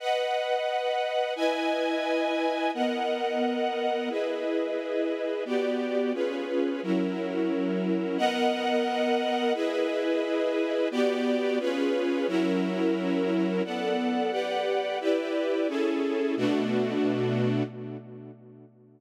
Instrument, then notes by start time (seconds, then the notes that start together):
string ensemble 1
0.00 B4 D#5 F#5
1.36 E4 B4 D#5 G#5
2.74 B3 A#4 D#5 F#5
4.09 E4 G#4 B4 D#5
5.45 B3 F#4 G4 D5
6.14 C#4 F4 G#4 B4
6.83 F#3 C#4 E4 A#4
8.18 B3 A#4 D#5 F#5
9.54 E4 G#4 B4 D#5
10.91 B3 F#4 G4 D5
11.59 C#4 F4 G#4 B4
12.27 F#3 C#4 E4 A#4
13.64 B3 A4 D5 F#5
14.31 G4 B4 D5 F#5
15.00 E4 G4 B4 D5
15.68 C#4 E4 G#4 A4
16.37 B2 A3 D4 F#4